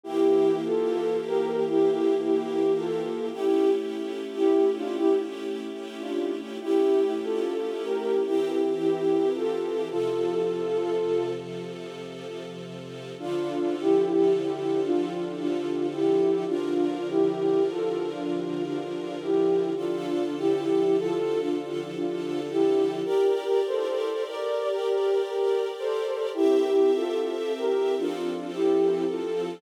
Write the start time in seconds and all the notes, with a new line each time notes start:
0.04 E3 A#3 E4 G4
0.65 F4 A4
1.27 G4 A#4
1.68 E4 G4
2.23 E4 G4
2.77 F4 A4
3.32 A3 C#4 E4 G4
4.35 E4 G4
4.76 D4 F4
4.97 E4 G4
5.99 D4 F4
6.61 A3 C#4 E4 G4
7.23 F4 A4
7.84 G4 A#4
8.26 E3 C4 E4 G4
8.80 E4 G4
9.35 F4 A4
9.89 C3 F3 F4 A4
13.19 D3 F3 D4 F4 A4
13.80 E4 G4
14.42 E4 G4
14.83 D4 F4
15.38 D4 F4
15.93 E4 G4
16.47 D3 F3 D4 F4 A#4
17.09 E4 G4
17.71 F4 A4
18.11 D4 F4
18.67 D4 F4
19.22 E4 G4
19.76 D3 F3 D4 F4 A4
20.38 E4 G4
20.99 F4 A4
21.41 D4 F4
21.95 D4 F4
22.50 E4 G4
23.04 G4 A#4 D5
23.67 A4 C5
24.28 A#4 D5
24.69 G4 A#4
25.24 G4 A#4
25.79 A4 C5
26.34 C4 E4 G4 E5
26.95 F4 A4
27.57 G4 A#4
27.97 F3 C4 D4 F4 A4
28.53 E4 G4
29.08 F4 A4